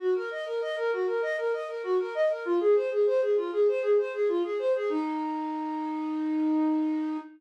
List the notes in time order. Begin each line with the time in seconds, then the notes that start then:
0.00 F#4
0.15 A#4
0.31 D#5
0.46 A#4
0.61 D#5
0.76 A#4
0.92 F#4
1.07 A#4
1.22 D#5
1.38 A#4
1.53 D#5
1.68 A#4
1.83 F#4
1.99 A#4
2.15 D#5
2.30 A#4
2.45 F4
2.60 G#4
2.75 C5
2.91 G#4
3.07 C5
3.21 G#4
3.37 F4
3.52 G#4
3.68 C5
3.82 G#4
3.98 C5
4.14 G#4
4.28 F4
4.44 G#4
4.59 C5
4.75 G#4
4.90 D#4